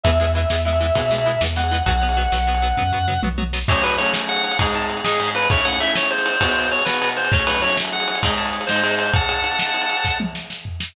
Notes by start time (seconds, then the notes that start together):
0.04 E2 E3 G#3 B3 E5, kick, ride
0.20 E3 G#3 B3
0.27 ride
0.35 E3 G#3 B3 E5
0.50 E2 E3 G#3 B3, snare
0.65 E3 G#3 B3 E5
0.73 ride
0.80 E3 G#3 B3
0.95 B2 E3 G#3 B3, kick, ride
1.11 E3 G#3 B3
1.18 ride
1.26 E3 G#3 B3
1.41 E2 E3 G#3 B3, snare
1.56 E3 G#3 B3 F#5
1.64 ride
1.71 E3 G#3 B3
1.86 B1 F#3 B3 F#5, kick, ride
2.02 F#3 B3
2.09 ride
2.17 F#3 B3
2.32 B1 F#3 B3, snare
2.47 F#3 B3
2.55 ride
2.62 F#3 B3
2.77 F#2 F#3 B3, kick, floor tom
2.92 F#3 B3, floor tom
3.08 F#3 B3, mid tom
3.23 B1 F#3 B3, high tom
3.38 F#3 B3, high tom
3.53 F#3 B3, snare
3.68 F#3 A3 C#4 C#5, kick, crash
3.76 ride
3.83 F#3 A3 C#4 B4, ride
3.91 ride
3.98 F#3 A3 C#4 C#5, ride
4.06 ride
4.14 snare
4.21 ride
4.29 F#5, ride
4.36 ride
4.44 ride
4.51 ride
4.59 G#2 G#3 D#4, kick, ride
4.67 ride
4.74 A5, ride
4.82 ride
4.90 ride
4.97 ride
5.04 G#2 G#3 D#4 G#4, snare
5.12 ride
5.20 G#2 G#3 D#4, ride
5.27 ride
5.35 B4, ride
5.43 ride
5.50 A3 C#4 E4 C#5, kick, ride
5.58 ride
5.65 A3 C#4 E4 F#5, ride
5.73 ride
5.80 A3 C#4 E4 E5, ride
5.88 ride
5.96 C#5, snare
6.03 ride
6.11 C5, ride
6.18 ride
6.26 ride
6.33 ride
6.41 B2 B3 F#4, kick, ride
6.49 ride
6.56 ride
6.64 ride
6.71 C#5, ride
6.79 ride
6.85 B2 B3 F#4 B4, snare
6.94 ride
7.01 B2 B3 F#4, ride
7.09 ride
7.17 C5, ride
7.25 ride
7.32 F#3 A3 C#4 C#5, kick
7.40 ride
7.47 F#3 A3 C#4 B4, ride
7.55 ride
7.62 F#3 A3 C#4 C#5, ride
7.70 ride
7.77 snare
7.85 ride
7.92 F#5, ride
8.00 ride
8.08 ride
8.15 ride
8.23 G#2 G#3 D#4, kick, ride
8.30 ride
8.37 A5, ride
8.46 ride
8.53 ride
8.61 ride
8.67 G#2 G#3 C5, snare
8.71 D#4
8.76 ride
8.83 G#2 G#3 D#4, ride
8.91 ride
8.99 C5, ride
9.06 ride
9.14 F#5 A5, kick, ride
9.21 ride
9.29 ride
9.44 ride
9.52 ride
9.59 snare
9.67 ride
9.74 ride
9.82 ride
9.89 ride
9.97 ride
10.04 kick, snare
10.20 high tom
10.35 snare
10.50 snare
10.65 floor tom
10.80 snare